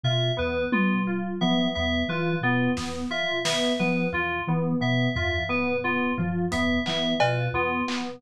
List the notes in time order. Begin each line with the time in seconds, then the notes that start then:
0.03 B2 F4 E5
0.37 E2 B3 B4
0.72 B3 F4, high tom
1.07 F4
1.41 F3 B3 E5
1.75 E2 B3 E5
2.08 E3 F4 B4
2.41 B2 B3 F4
2.77 E2 B3, snare
3.11 F4 E5
3.45 B3 E5, snare
3.79 F3 B3 B4
4.12 E2 F4
4.47 E3 B3
4.80 B2 B3 E5
5.14 E2 F4 E5, floor tom
5.49 B3 B4
5.84 B3 F4
6.18 F3 F4, floor tom
6.52 E2 B3 E5, closed hi-hat
6.86 E3 B3 E5, clap
7.20 B2 F4 B4, cowbell
7.53 E2 B3 F4
7.88 B3, clap